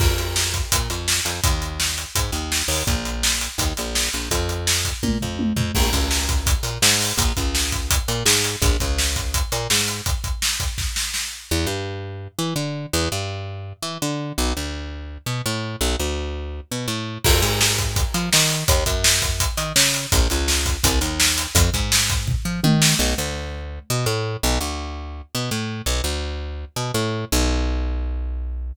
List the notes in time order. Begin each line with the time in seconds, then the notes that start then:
0.00 F2, kick, crash
0.18 closed hi-hat
0.36 snare
0.54 kick, closed hi-hat
0.72 A#2, kick, closed hi-hat
0.90 F2, closed hi-hat
1.08 snare
1.25 F2, closed hi-hat
1.44 D#2, kick, closed hi-hat
1.62 closed hi-hat
1.80 snare
1.98 closed hi-hat
2.15 G#2, kick, closed hi-hat
2.32 D#2, closed hi-hat
2.52 snare
2.68 D#2, open hi-hat
2.87 A#1, kick, closed hi-hat
3.05 closed hi-hat
3.23 snare
3.41 closed hi-hat
3.58 D#2, kick, closed hi-hat
3.77 A#1, closed hi-hat
3.95 snare
4.13 A#1, closed hi-hat
4.31 F2, kick, closed hi-hat
4.49 closed hi-hat
4.67 snare
4.85 kick, closed hi-hat
5.03 A#2, kick, high tom
5.21 F2, floor tom
5.39 high tom
5.56 F2, floor tom
5.75 A#1, kick, crash
5.93 C#2, kick, closed hi-hat
6.11 snare
6.29 kick, closed hi-hat
6.46 kick, closed hi-hat
6.63 A#2, closed hi-hat
6.82 G#2, snare
7.01 open hi-hat
7.17 A#1, kick, closed hi-hat
7.37 C#2, kick, closed hi-hat
7.55 snare
7.72 kick, closed hi-hat
7.91 kick, closed hi-hat
8.08 A#2, closed hi-hat
8.26 G#2, snare
8.44 closed hi-hat
8.62 A#1, kick, closed hi-hat
8.80 C#2, kick, closed hi-hat
8.99 snare
9.16 kick, closed hi-hat
9.34 kick, closed hi-hat
9.52 A#2, closed hi-hat
9.70 G#2, snare
9.88 closed hi-hat
10.06 kick, closed hi-hat
10.24 kick, closed hi-hat
10.42 snare
10.60 kick, closed hi-hat
10.78 kick, snare
10.96 snare
11.14 snare
11.51 E2
11.67 G2
12.39 E3
12.56 D3
12.93 E2
13.12 G2
13.82 E3
14.02 D3
14.38 B1
14.57 D2
15.26 B2
15.46 A2
15.81 B1
15.99 D2
16.71 B2
16.88 A2
17.24 F2, kick, crash
17.42 G#2, closed hi-hat
17.61 snare
17.78 kick, closed hi-hat
17.96 kick, closed hi-hat
18.14 F3, closed hi-hat
18.33 D#3, snare
18.50 closed hi-hat
18.68 D#2, kick, closed hi-hat
18.86 F#2, kick, closed hi-hat
19.04 snare
19.22 kick, closed hi-hat
19.40 kick, closed hi-hat
19.57 D#3, closed hi-hat
19.76 C#3, snare
19.94 closed hi-hat
20.12 A#1, kick, closed hi-hat
20.30 C#2, closed hi-hat
20.48 snare
20.66 kick, closed hi-hat
20.84 C2, kick, closed hi-hat
21.01 D#2, closed hi-hat
21.20 snare
21.38 closed hi-hat
21.55 F2, kick, closed hi-hat
21.74 G#2, kick, closed hi-hat
21.92 snare
22.10 kick, closed hi-hat
22.27 kick, floor tom
22.45 F3
22.64 D#3, high tom
22.82 snare
22.99 B1
23.18 D2
23.90 B2
24.06 A2
24.43 B1
24.61 D2
25.35 B2
25.51 A2
25.86 B1
26.04 D2
26.76 B2
26.94 A2
27.32 B1